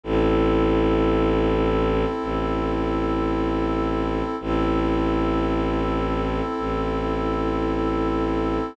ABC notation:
X:1
M:4/4
L:1/8
Q:1/4=55
K:Ador
V:1 name="Pad 2 (warm)"
[CEA]8 | [CEA]8 |]
V:2 name="Violin" clef=bass
A,,,4 A,,,4 | A,,,4 A,,,4 |]